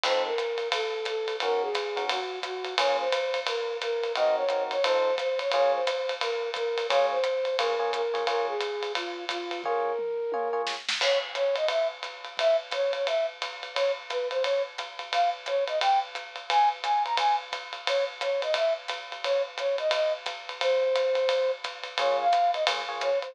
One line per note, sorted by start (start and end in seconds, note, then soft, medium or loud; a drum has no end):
0.03 0.30 F3 medium
0.03 0.30 C4 medium
0.03 0.30 D#4 medium
0.03 0.30 A4 medium
0.03 0.22 C5 loud
0.03 crash medium
0.03 ride loud
0.25 0.68 A#4 medium
0.38 hi-hat pedal medium
0.38 ride medium
0.58 ride medium
0.72 1.06 A4 medium
0.72 kick medium
0.72 ride loud
1.05 1.36 A4 medium
1.05 hi-hat pedal medium
1.05 ride medium
1.28 ride medium
1.40 1.68 D#3 medium
1.40 1.68 C#4 medium
1.40 1.68 F#4 medium
1.40 1.62 A#4 loud
1.40 1.68 A#4 medium
1.40 ride medium
1.61 2.04 G#4 medium
1.74 kick medium
1.74 hi-hat pedal medium
1.74 ride medium
1.96 2.18 D#3 medium
1.96 2.18 C#4 medium
1.96 2.18 F#4 medium
1.96 2.18 A#4 medium
1.96 ride medium
2.09 2.39 F#4 medium
2.09 ride loud
2.42 2.74 F#4 medium
2.42 kick medium
2.42 hi-hat pedal medium
2.42 ride medium
2.64 ride medium
2.78 3.05 A#3 medium
2.78 3.05 C#4 medium
2.78 3.05 F4 medium
2.78 3.05 G#4 medium
2.78 2.97 C#5 loud
2.78 ride loud
2.99 3.40 C5 medium
3.12 hi-hat pedal medium
3.12 ride medium
3.34 ride medium
3.47 3.77 A#4 medium
3.47 ride loud
3.81 4.12 A#4 medium
3.81 hi-hat pedal medium
3.81 ride medium
4.03 ride medium
4.15 4.43 C4 medium
4.15 4.43 D#4 medium
4.15 4.43 F#4 medium
4.15 4.43 A#4 medium
4.15 4.36 D#5 loud
4.15 ride medium
4.36 4.63 C#5 medium
4.49 4.76 C4 medium
4.49 4.76 D#4 medium
4.49 4.76 F#4 medium
4.49 4.76 A#4 medium
4.49 hi-hat pedal medium
4.49 ride medium
4.71 4.84 C#5 medium
4.71 ride medium
4.83 5.11 F3 medium
4.83 5.11 D#4 medium
4.83 5.11 A4 medium
4.83 5.15 C5 loud
4.83 5.11 C5 medium
4.83 ride loud
5.18 5.39 C5 medium
5.18 kick medium
5.18 hi-hat pedal medium
5.18 ride medium
5.39 5.51 C#5 medium
5.39 ride medium
5.52 5.80 A#3 medium
5.52 5.80 F4 medium
5.52 5.80 G#4 medium
5.52 5.72 C#5 loud
5.52 5.80 C#5 medium
5.52 ride medium
5.74 6.13 C5 medium
5.87 hi-hat pedal medium
5.87 ride medium
6.09 ride medium
6.21 6.50 A#4 medium
6.21 ride medium
6.54 6.86 A#4 medium
6.54 kick medium
6.54 hi-hat pedal medium
6.54 ride medium
6.78 ride medium
6.89 7.16 A#3 medium
6.89 7.16 F4 medium
6.89 7.16 G#4 medium
6.89 7.06 C#5 loud
6.89 7.16 C#5 medium
6.89 kick medium
6.89 ride loud
7.11 7.57 C5 medium
7.24 hi-hat pedal medium
7.24 ride medium
7.45 ride medium
7.58 7.74 A#3 medium
7.58 7.74 F4 medium
7.58 7.74 G#4 medium
7.58 7.91 A#4 medium
7.58 7.74 C#5 medium
7.58 ride loud
7.79 8.01 A#3 medium
7.79 8.01 F4 medium
7.79 8.01 G#4 medium
7.79 8.01 C#5 medium
7.93 8.26 A#4 medium
7.93 hi-hat pedal medium
7.93 ride medium
8.13 8.23 A#3 medium
8.13 8.23 F4 medium
8.13 8.23 G#4 medium
8.13 8.23 C#5 medium
8.13 ride medium
8.27 8.53 A#3 medium
8.27 8.53 F4 medium
8.27 8.53 G#4 medium
8.27 8.46 A#4 medium
8.27 8.53 C#5 medium
8.27 ride medium
8.48 8.92 G#4 medium
8.61 hi-hat pedal medium
8.61 ride medium
8.83 ride medium
8.95 9.25 F4 medium
8.95 kick soft
8.95 ride medium
9.29 9.62 F4 medium
9.29 kick medium
9.29 hi-hat pedal medium
9.29 ride medium
9.51 ride medium
9.63 9.92 A#3 medium
9.63 9.92 F4 medium
9.63 9.92 G#4 medium
9.63 10.62 A#4 medium
9.63 9.92 C#5 medium
9.63 kick medium
9.63 floor tom medium
9.86 floor tom medium
9.98 mid tom medium
10.32 10.48 A#3 medium
10.32 10.48 F4 medium
10.32 10.48 G#4 medium
10.32 10.48 C#5 medium
10.32 high tom medium
10.53 10.75 A#3 medium
10.53 10.75 F4 medium
10.53 10.75 G#4 medium
10.53 10.75 C#5 medium
10.67 snare medium
10.89 snare loud
11.01 11.18 C#5 loud
11.01 kick medium
11.01 crash loud
11.01 ride medium
11.35 11.55 C#5 loud
11.35 hi-hat pedal medium
11.35 ride medium
11.56 11.67 D#5 medium
11.56 ride medium
11.68 11.87 E5 medium
11.68 ride medium
12.03 hi-hat pedal medium
12.03 ride medium
12.25 ride medium
12.37 12.56 E5 loud
12.37 kick medium
12.37 ride medium
12.71 12.92 C#5 medium
12.71 kick medium
12.71 hi-hat pedal medium
12.71 ride medium
12.93 13.06 C#5 medium
12.93 ride medium
13.07 13.26 E5 medium
13.07 ride medium
13.42 hi-hat pedal medium
13.42 ride medium
13.63 ride medium
13.75 13.92 C#5 loud
13.75 ride medium
14.09 14.28 B4 medium
14.09 hi-hat pedal medium
14.09 ride medium
14.30 14.43 C5 medium
14.30 ride medium
14.43 14.62 C#5 medium
14.43 ride medium
14.78 hi-hat pedal medium
14.78 ride medium
14.99 ride medium
15.12 15.30 F5 medium
15.12 ride medium
15.46 15.64 C#5 medium
15.46 hi-hat pedal medium
15.46 ride medium
15.67 15.79 D#5 medium
15.67 ride medium
15.81 15.99 G5 medium
15.81 ride loud
16.15 hi-hat pedal medium
16.15 ride medium
16.36 ride medium
16.50 16.69 G#5 loud
16.50 ride loud
16.83 17.03 G#5 medium
16.83 hi-hat pedal medium
16.83 ride medium
17.05 17.16 A#5 medium
17.05 ride medium
17.17 17.36 G#5 medium
17.17 kick medium
17.17 ride loud
17.52 kick medium
17.52 hi-hat pedal medium
17.52 ride medium
17.73 ride medium
17.87 18.04 C#5 medium
17.87 ride loud
18.21 18.41 C#5 medium
18.21 hi-hat pedal medium
18.21 ride medium
18.42 18.54 D#5 medium
18.42 ride medium
18.54 18.73 E5 medium
18.54 kick medium
18.54 ride medium
18.88 hi-hat pedal medium
18.88 ride medium
19.12 ride medium
19.24 19.42 C#5 loud
19.24 ride medium
19.58 19.76 C#5 medium
19.58 hi-hat pedal medium
19.58 ride medium
19.78 19.92 D#5 medium
19.78 ride medium
19.91 20.13 D#5 medium
19.91 ride loud
20.26 kick medium
20.26 hi-hat pedal medium
20.26 ride medium
20.49 ride medium
20.60 21.51 C5 loud
20.60 ride medium
20.95 hi-hat pedal medium
20.95 ride medium
21.15 ride medium
21.29 ride medium
21.64 kick medium
21.64 hi-hat pedal medium
21.64 ride medium
21.83 ride medium
21.98 22.25 A#3 medium
21.98 22.25 F4 medium
21.98 22.25 G#4 medium
21.98 22.25 C#5 medium
21.98 22.16 C#5 medium
21.98 kick medium
21.98 ride loud
22.19 22.51 F5 medium
22.33 hi-hat pedal medium
22.33 ride medium
22.54 22.64 D#5 medium
22.54 ride medium
22.67 22.82 A#3 medium
22.67 22.82 F4 medium
22.67 22.82 G#4 medium
22.67 22.82 C#5 medium
22.67 ride loud
22.88 23.10 A#3 medium
22.88 23.10 F4 medium
22.88 23.10 G#4 medium
22.88 23.10 C#5 medium
23.01 23.19 C#5 loud
23.01 hi-hat pedal medium
23.01 ride medium
23.22 23.35 C5 medium
23.22 ride medium